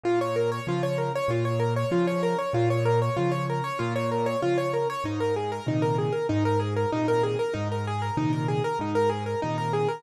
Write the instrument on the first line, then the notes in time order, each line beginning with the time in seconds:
acoustic grand piano
0.04 A#2 F4
0.21 C#5
0.36 A#4
0.52 C#5
0.67 C#3 F3 F4
0.83 C#5
0.98 A#4
1.15 C#5
1.28 A#2 F4
1.45 C#5
1.60 A#4
1.76 C#5
1.91 C#3 F3 F4
2.07 C#5
2.23 A#4
2.38 C#5
2.53 A#2 F4
2.70 C#5
2.85 A#4
3.02 C#5
3.17 C#3 F3 F4
3.32 C#5
3.50 A#4
3.64 C#5
3.79 A#2 F4
3.96 C#5
4.11 A#4
4.26 C#5
4.42 C#3 F3 F4
4.58 C#5
4.73 A#4
4.90 C#5
5.04 G#2 D#4
5.20 A#4
5.36 G#4
5.52 A#4
5.66 A#2 C3 D#3 D#4
5.82 A#4
5.98 G#4
6.12 A#4
6.29 G#2 D#4
6.45 A#4
6.60 G#4
6.76 A#4
6.92 A#2 C3 D#3 D#4
7.08 A#4
7.23 G#4
7.39 A#4
7.54 G#2 D#4
7.71 A#4
7.87 G#4
8.02 A#4
8.17 A#2 C3 D#3 D#4
8.33 A#4
8.48 G#4
8.64 A#4
8.79 G#2 D#4
8.95 A#4
9.10 G#4
9.26 A#4
9.42 A#2 C3 D#3 D#4
9.58 A#4
9.73 G#4
9.89 A#4